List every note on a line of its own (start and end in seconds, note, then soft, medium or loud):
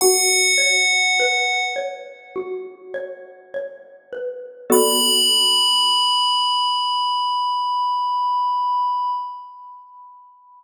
0.01 2.35 F#4 loud
0.01 1.64 F#5 medium
0.58 1.75 C#5 medium
1.20 4.12 B4 medium
1.76 2.94 C#5 medium
2.36 4.59 F#4 medium
2.94 3.54 C#5 medium
3.54 4.66 C#5 medium
4.13 4.68 B4 medium
4.70 9.08 B3 loud
4.70 9.08 F#4 medium
4.70 9.08 A4 loud
4.70 9.08 D5 medium
4.70 9.10 B5 loud